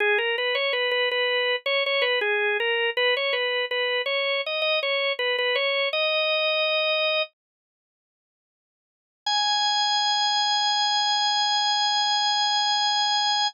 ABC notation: X:1
M:4/4
L:1/16
Q:1/4=81
K:G#m
V:1 name="Drawbar Organ"
G A B c B B B3 c c B G2 A2 | B c B2 B2 c2 d d c2 B B c2 | "^rit." d8 z8 | g16 |]